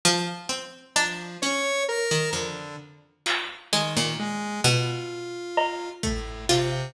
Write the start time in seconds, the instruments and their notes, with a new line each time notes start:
0.05 pizzicato strings F3
0.49 pizzicato strings C4
0.96 lead 1 (square) F3, pizzicato strings D4, cowbell
1.42 pizzicato strings C#4, lead 1 (square) C#5
1.88 lead 1 (square) A#4
2.11 pizzicato strings D#3
2.33 pizzicato strings F2, lead 1 (square) D3
3.26 pizzicato strings F4, clap
3.72 lead 1 (square) D#3, pizzicato strings G#3, closed hi-hat
3.97 pizzicato strings A#2
4.19 lead 1 (square) G#3
4.64 pizzicato strings B2, lead 1 (square) F4
5.57 cowbell
6.03 lead 1 (square) A2, pizzicato strings A3, kick
6.49 lead 1 (square) C3, pizzicato strings F4, clap